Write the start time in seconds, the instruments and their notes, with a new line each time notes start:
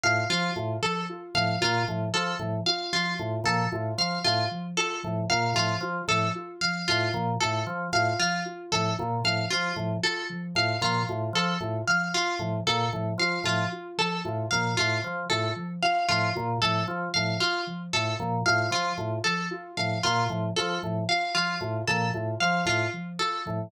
0.04 drawbar organ A2, ocarina F4, pizzicato strings F5
0.30 drawbar organ F3, ocarina F3, pizzicato strings F4
0.56 drawbar organ A2, ocarina F4
0.82 ocarina F3, pizzicato strings A4
1.09 ocarina F4
1.35 drawbar organ A2, ocarina F3, pizzicato strings F5
1.61 drawbar organ A#2, ocarina F4, pizzicato strings F4
1.88 drawbar organ A2, ocarina F3
2.14 drawbar organ F3, ocarina F4, pizzicato strings A4
2.39 drawbar organ A2, ocarina F3
2.66 ocarina F4, pizzicato strings F5
2.93 ocarina F3, pizzicato strings F4
3.19 drawbar organ A2, ocarina F4
3.44 drawbar organ A#2, ocarina F3, pizzicato strings A4
3.72 drawbar organ A2, ocarina F4
3.98 drawbar organ F3, ocarina F3, pizzicato strings F5
4.24 drawbar organ A2, ocarina F4, pizzicato strings F4
4.51 ocarina F3
4.77 ocarina F4, pizzicato strings A4
5.03 drawbar organ A2, ocarina F3
5.30 drawbar organ A#2, ocarina F4, pizzicato strings F5
5.54 drawbar organ A2, ocarina F3, pizzicato strings F4
5.81 drawbar organ F3, ocarina F4
6.08 drawbar organ A2, ocarina F3, pizzicato strings A4
6.35 ocarina F4
6.61 ocarina F3, pizzicato strings F5
6.88 drawbar organ A2, pizzicato strings F4, ocarina F4
7.14 drawbar organ A#2, ocarina F3
7.40 drawbar organ A2, ocarina F4, pizzicato strings A4
7.67 ocarina F3, drawbar organ F3
7.93 drawbar organ A2, ocarina F4, pizzicato strings F5
8.19 ocarina F3, pizzicato strings F4
8.46 ocarina F4
8.72 drawbar organ A2, ocarina F3, pizzicato strings A4
8.98 drawbar organ A#2, ocarina F4
9.24 drawbar organ A2, ocarina F3, pizzicato strings F5
9.50 drawbar organ F3, pizzicato strings F4, ocarina F4
9.76 drawbar organ A2, ocarina F3
10.03 ocarina F4, pizzicato strings A4
10.30 ocarina F3
10.55 drawbar organ A2, ocarina F4, pizzicato strings F5
10.81 drawbar organ A#2, ocarina F3, pizzicato strings F4
11.09 drawbar organ A2, ocarina F4
11.33 drawbar organ F3, ocarina F3, pizzicato strings A4
11.60 drawbar organ A2, ocarina F4
11.88 ocarina F3, pizzicato strings F5
12.14 ocarina F4, pizzicato strings F4
12.39 drawbar organ A2, ocarina F3
12.67 drawbar organ A#2, ocarina F4, pizzicato strings A4
12.93 drawbar organ A2, ocarina F3
13.18 drawbar organ F3, ocarina F4, pizzicato strings F5
13.44 drawbar organ A2, ocarina F3, pizzicato strings F4
13.72 ocarina F4
13.98 ocarina F3, pizzicato strings A4
14.25 drawbar organ A2, ocarina F4
14.51 drawbar organ A#2, ocarina F3, pizzicato strings F5
14.77 drawbar organ A2, ocarina F4, pizzicato strings F4
15.03 ocarina F3, drawbar organ F3
15.30 drawbar organ A2, ocarina F4, pizzicato strings A4
15.56 ocarina F3
15.82 ocarina F4, pizzicato strings F5
16.09 drawbar organ A2, ocarina F3, pizzicato strings F4
16.35 drawbar organ A#2, ocarina F4
16.62 drawbar organ A2, ocarina F3, pizzicato strings A4
16.88 drawbar organ F3, ocarina F4
17.14 drawbar organ A2, ocarina F3, pizzicato strings F5
17.40 pizzicato strings F4, ocarina F4
17.67 ocarina F3
17.93 drawbar organ A2, ocarina F4, pizzicato strings A4
18.19 drawbar organ A#2, ocarina F3
18.46 drawbar organ A2, ocarina F4, pizzicato strings F5
18.71 drawbar organ F3, ocarina F3, pizzicato strings F4
18.98 drawbar organ A2, ocarina F4
19.24 ocarina F3, pizzicato strings A4
19.51 ocarina F4
19.77 drawbar organ A2, ocarina F3, pizzicato strings F5
20.03 drawbar organ A#2, pizzicato strings F4, ocarina F4
20.29 drawbar organ A2, ocarina F3
20.56 drawbar organ F3, ocarina F4, pizzicato strings A4
20.82 drawbar organ A2, ocarina F3
21.09 ocarina F4, pizzicato strings F5
21.35 ocarina F3, pizzicato strings F4
21.61 drawbar organ A2, ocarina F4
21.88 drawbar organ A#2, ocarina F3, pizzicato strings A4
22.14 drawbar organ A2, ocarina F4
22.40 ocarina F3, drawbar organ F3, pizzicato strings F5
22.66 drawbar organ A2, ocarina F4, pizzicato strings F4
22.93 ocarina F3
23.19 ocarina F4, pizzicato strings A4
23.46 drawbar organ A2, ocarina F3